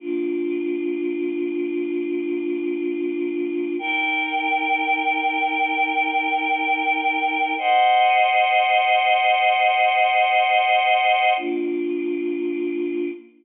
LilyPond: \new Staff { \time 3/4 \key bes \mixolydian \tempo 4 = 95 <bes d' f'>2.~ | <bes d' f'>2. | <ees' bes' g''>2.~ | <ees' bes' g''>2. |
<c'' ees'' ges''>2.~ | <c'' ees'' ges''>2. | <bes d' f'>2. | }